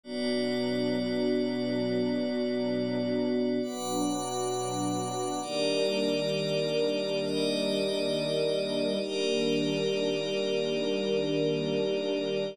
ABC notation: X:1
M:6/8
L:1/8
Q:3/8=67
K:D
V:1 name="String Ensemble 1"
[B,,F,D]6- | [B,,F,D]6 | [B,,F,D]6 | [K:Eb] [E,G,B,D]6- |
[E,G,B,D]6 | [E,G,B,D]6- | [E,G,B,D]6 |]
V:2 name="Pad 5 (bowed)"
[B,Fd]6- | [B,Fd]6 | [Bfd']6 | [K:Eb] [EGBd]6 |
[EGde]6 | [EGBd]6- | [EGBd]6 |]